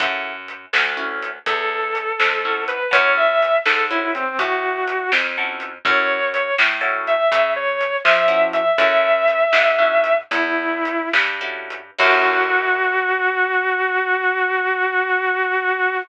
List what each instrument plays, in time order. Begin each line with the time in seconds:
0.00 electric bass (finger) F#2, acoustic guitar (steel) C#4 E4 F#4 A4, kick, closed hi-hat
0.48 closed hi-hat
0.73 electric bass (finger) D2, snare
0.97 acoustic guitar (steel) C#4 E4 F#4 A4
1.22 closed hi-hat
1.46 electric bass (finger) E2, distortion guitar A4, kick, closed hi-hat
1.95 closed hi-hat
2.20 electric bass (finger) F2, snare
2.45 acoustic guitar (steel) C#4 E4 F#4 A4
2.68 distortion guitar B4, closed hi-hat
2.91 electric bass (finger) F#2, acoustic guitar (steel) C#4 E4 F#4 A4, distortion guitar C#5, kick, closed hi-hat
3.17 distortion guitar E5
3.42 closed hi-hat
3.66 electric bass (finger) G#2, distortion guitar A4, snare
3.90 acoustic guitar (steel) C#4 E4 F#4 A4, distortion guitar E4
4.15 distortion guitar C4, closed hi-hat
4.38 electric bass (finger) A2, distortion guitar F#4, kick, closed hi-hat
4.88 closed hi-hat
5.12 electric bass (finger) F2, snare
5.38 acoustic guitar (steel) C#4 E4 F#4 A4
5.60 closed hi-hat
5.85 electric bass (finger) F#2, acoustic guitar (steel) C#4 E4 F#4 A4, distortion guitar C#5, kick, closed hi-hat
6.34 distortion guitar C#5, closed hi-hat
6.58 electric bass (finger) A2, snare
6.81 acoustic guitar (steel) C#4 E4 F#4 A4
7.07 distortion guitar E5, closed hi-hat
7.32 electric bass (finger) C#3, kick, closed hi-hat
7.56 distortion guitar C#5
7.81 closed hi-hat
8.04 electric bass (finger) F3, distortion guitar E5, snare
8.28 acoustic guitar (steel) C#4 E4 F#4 A4
8.53 distortion guitar E5, closed hi-hat
8.78 electric bass (finger) F#2, acoustic guitar (steel) C#4 E4 F#4 A4, distortion guitar E5, kick, closed hi-hat
9.28 closed hi-hat
9.53 electric bass (finger) G#2, snare
9.79 acoustic guitar (steel) C#4 E4 F#4 A4
10.04 closed hi-hat
10.31 electric bass (finger) E2, distortion guitar E4, kick, closed hi-hat
10.85 closed hi-hat
11.13 electric bass (finger) G2, snare
11.41 acoustic guitar (steel) C#4 E4 F#4 A4
11.70 closed hi-hat
11.98 electric bass (finger) F#2, acoustic guitar (steel) C#4 E4 F#4 A4, distortion guitar F#4, kick, crash